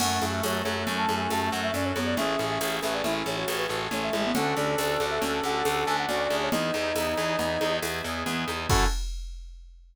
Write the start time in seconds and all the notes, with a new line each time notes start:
0.00 F#2 A3 C#4 E4 F#4 A4 F#5, crash, low conga, shaker
0.22 F#2 E4, high conga, shaker
0.32 E5
0.43 F#2 F#4 C#5, tambourine, high conga, shaker
0.64 F#2 A4 C#5, high conga, shaker
0.87 F#2 C#4, low conga, shaker
0.97 A5
1.09 F#2 E4, high conga, shaker
1.20 G#5
1.30 F#2 F#4 A5, tambourine, high conga, shaker
1.41 A5
1.52 F#2 A4 F#5, shaker
1.63 E5
1.74 F#2 C#4 D5, low conga, shaker
1.85 C#5
1.95 F#2 B3 E4 C#5, high conga, shaker
2.06 D5
2.16 A1 C#4 E4 G#4 A4 E5, low conga, shaker
2.39 A1 E4 G#4, high conga, shaker
2.50 E5
2.61 A1 G#4 C#5, tambourine, high conga, shaker
2.82 A1 A4 B4 E5, high conga, shaker
2.94 D5
3.04 A1 C#4 E4 E5, low conga, shaker
3.26 A1 E4 C#5, high conga, shaker
3.36 F#4 C#5
3.48 A1 G#4, tambourine, high conga, shaker
3.58 B4
3.69 A1 F#4 A4, shaker
3.91 A1 A3 C#4 C#5, low conga, shaker
4.03 E5
4.13 A1 G#3 E4, high conga, shaker
4.24 B3
4.35 D2 C#4 D4 F#4 A4 F#5, low conga, shaker
4.56 D2 D4 D5, high conga, shaker
4.78 D2 F#4 D5, tambourine, high conga, shaker
5.00 D2 A4, high conga, shaker
5.10 E5
5.21 D2 C#4, low conga, shaker
5.44 D2 D4 F#5, high conga, shaker
5.65 D2 F#4, tambourine, high conga, shaker
5.86 D2 A4 G#5, shaker
5.99 F#5
6.08 D2 C#4 F#4 D5, low conga, shaker
6.19 D5
6.30 D2 D4 G#4, high conga, shaker
6.43 C#5
6.52 E2 B3 D#4 E4 G#4 D#5, low conga, shaker
6.74 E2 D#4, high conga, shaker
6.95 E2 E4, tambourine, high conga, shaker
7.17 E2 G#4, high conga, shaker
7.39 E2 B3, low conga, shaker
7.61 E2 D#4, high conga, shaker
7.82 E2 E4, tambourine, high conga, shaker
8.04 E2 G#4, shaker
8.26 E2 B3, low conga, shaker
8.48 E2 D#4, high conga, shaker
8.69 F#2 C#4 E4 F#4 A4 F#5, kick, crash